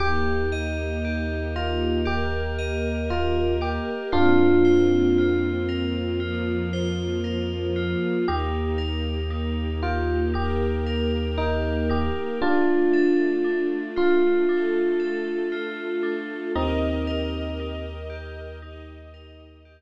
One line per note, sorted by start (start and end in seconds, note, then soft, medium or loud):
0.00 3.79 D#2 medium
0.00 2.04 A#3 medium
0.00 2.04 D#4 medium
0.00 1.04 G4 loud
0.00 2.04 G4 medium
0.00 0.45 G4 loud
0.52 2.58 D#5 medium
1.05 2.05 G4 medium
1.56 1.98 F4 medium
1.56 3.10 A#4 medium
2.05 4.12 A#3 medium
2.05 3.61 G4 loud
2.05 2.71 G4 medium
2.05 4.12 G4 medium
2.05 4.12 A#4 medium
2.59 4.06 D#5 medium
3.10 3.53 F4 loud
3.10 4.09 A#4 medium
3.61 4.10 G4 medium
3.61 4.04 G4 medium
4.12 7.95 F2 medium
4.12 6.19 A#3 medium
4.12 6.19 C4 medium
4.12 5.49 D4 loud
4.12 5.18 F4 loud
4.12 5.49 F4 loud
4.12 6.19 F4 medium
4.65 6.73 C5 medium
5.18 6.19 F4 medium
5.69 7.23 A#4 medium
6.20 8.26 F3 medium
6.20 8.26 A#3 medium
6.20 7.75 F4 medium
6.20 8.26 F4 medium
6.73 8.20 C5 medium
7.24 8.22 A#4 medium
7.76 8.25 F4 medium
8.28 12.10 D#2 medium
8.28 10.33 A#3 medium
8.28 10.33 D#4 medium
8.28 9.30 D#4 loud
8.28 10.33 G4 medium
8.28 8.72 G4 loud
8.78 10.86 A#4 medium
9.30 10.33 D#4 medium
9.83 10.24 F4 loud
9.83 11.37 G4 medium
10.34 12.40 A#3 medium
10.34 11.89 D#4 medium
10.34 11.00 G4 medium
10.34 12.40 G4 medium
10.34 12.40 A#4 medium
10.86 12.34 A#4 medium
11.38 11.88 D#4 loud
11.38 12.36 G4 medium
11.89 12.39 D#4 medium
11.89 12.39 G4 medium
12.41 14.46 A3 medium
12.41 14.46 D4 medium
12.41 13.67 D4 loud
12.41 13.44 D4 loud
12.41 14.46 F4 medium
12.41 13.67 F4 loud
12.93 14.99 A4 medium
13.44 14.48 D4 medium
13.96 15.52 F4 medium
13.96 15.40 F4 loud
14.48 16.53 A3 medium
14.48 16.02 D4 medium
14.48 16.53 F4 medium
14.48 16.53 A4 medium
15.00 16.47 A4 medium
15.52 16.50 F4 medium
16.03 16.52 D4 medium
16.55 19.81 D#2 medium
16.55 17.84 C4 medium
16.55 17.84 D#4 loud
16.55 17.59 D#4 loud
16.55 18.60 G4 medium
16.55 18.60 A#4 medium
16.55 18.60 D#5 medium
17.07 19.13 A#4 medium
17.60 18.62 D#4 medium
18.10 19.65 G4 medium
18.62 19.81 D#4 medium
18.62 19.81 G4 medium
18.62 19.81 D#5 medium
19.14 19.81 A#4 medium
19.65 19.81 G4 medium